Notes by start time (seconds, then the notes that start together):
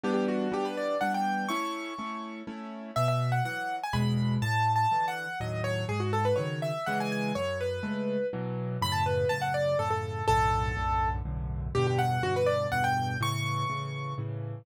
0.03 E3 G3 B3 D4 G4
0.14 G4
0.28 F#4
0.52 E3 G3 B3 D4 G4
0.65 B4
0.77 D5
1.01 E3 G3 B3 D4 F#5
1.14 G5
1.48 A3 C#4 E4 C#6
1.98 A3 C#4 E4
2.47 A3 C#4 E4
2.96 B2 E5
3.08 E5
3.32 F#5
3.45 E3 F#3 F#5
3.83 G#5
3.93 E2 B2 G#3 B5
4.42 A2 A5
4.76 A5
4.92 D3 E3
5.08 F#5
5.40 D#2 A2 F#3 D#5
5.64 C#5
5.89 G#2 G#4
6.00 F#4
6.13 A4
6.25 B4
6.36 C#3 D#3 F#3 C#5
6.62 E5
6.86 C#3 E3 G#3 F#5
7.00 G#5
7.12 G#5
7.35 F#2 C#5
7.60 B4
7.83 C#3 G#3 A3
8.33 B2 E3 F#3
8.82 F#2 A2 C#3 B5
8.92 A5
9.06 B4
9.29 F#2 A2 C#3 A5
9.41 F#5
9.54 D5
9.79 F#2 A2 C#3 A4
9.90 A4
10.28 B1 F#2 A2 D3 A4
10.76 B1 F#2 A2 D3
11.25 B1 F#2 A2 D3
11.75 E2 G2 B2 D3 G4
11.87 G4
11.98 F#5
12.23 E2 G2 B2 D3 F#4
12.36 B4
12.46 D5
12.72 E2 G2 B2 D3 F#5
12.84 G5
13.21 A2 C#3 E3 C#6
13.70 A2 C#3 E3
14.18 A2 C#3 E3